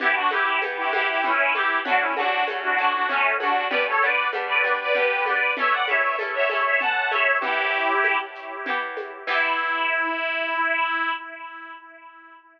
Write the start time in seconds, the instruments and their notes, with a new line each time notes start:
0.00 orchestral harp E3 B3 G4, accordion E4 G4, low conga, shaker
0.15 accordion D4 F#4
0.30 orchestral harp E3 B3 G4, accordion E4 G4, high conga, shaker
0.62 orchestral harp E3 B3 G4, tambourine, high conga, shaker
0.77 accordion E4 G4
0.93 orchestral harp E3 B3 G4, accordion E4 G4, high conga, shaker
1.09 accordion E4 G4
1.24 orchestral harp E3 B3 G4, accordion C#4 E4, low conga, shaker
1.54 orchestral harp E3 B3 G4, accordion E4 G4, high conga, shaker
1.85 orchestral harp F#3 A3 C#4, accordion D4 F#4, low conga, shaker
1.99 accordion C#4 E4
2.16 orchestral harp F#3 A3 C#4, accordion D4 F#4, high conga, shaker
2.47 orchestral harp F#3 A3 C#4, tambourine, high conga, shaker
2.63 accordion D4 F#4
2.78 orchestral harp F#3 A3 C#4, accordion D4 F#4, shaker
2.93 accordion D4 F#4
3.09 orchestral harp F#3 A3 C#4, accordion A3 C#4, low conga, shaker
3.40 orchestral harp F#3 A3 C#4, accordion D4 F#4, high conga, shaker
3.70 orchestral harp G3 B3 D4, accordion B4 D5, low conga, shaker
3.88 accordion A4 C#5
4.02 orchestral harp G3 B3 D4, accordion B4 D5, shaker
4.32 orchestral harp G3 B3 D4, tambourine, high conga, shaker
4.48 accordion B4 D5
4.64 orchestral harp G3 B3 D4, accordion B4 D5, shaker
4.80 accordion B4 D5
4.94 orchestral harp G3 B3 D4, accordion G4 B4, low conga, shaker
5.26 orchestral harp G3 B3 D4, accordion B4 D5, high conga, shaker
5.57 orchestral harp A3 C#4 E4, accordion C#5 E5, low conga, shaker
5.71 accordion D5 F#5
5.88 orchestral harp A3 C#4 E4, accordion C#5 E5, high conga, shaker
6.19 orchestral harp A3 C#4 E4, tambourine, high conga, shaker
6.35 accordion C#5 E5
6.49 orchestral harp A3 C#4 E4, accordion C#5 E5, high conga, shaker
6.64 accordion C#5 E5
6.80 orchestral harp A3 C#4 E4, accordion F#5 A5, low conga, shaker
7.10 orchestral harp A3 C#4, accordion C#5 E5, high conga, shaker
7.14 orchestral harp E4
7.40 orchestral harp E3 B3, accordion E4 G4, low conga, shaker
7.45 orchestral harp G4
7.73 shaker
8.04 tambourine, high conga, shaker
8.35 shaker
8.66 orchestral harp E3 B3 G4, low conga, shaker
8.97 high conga, shaker
9.27 orchestral harp E3 B3 G4, accordion E4, kick, crash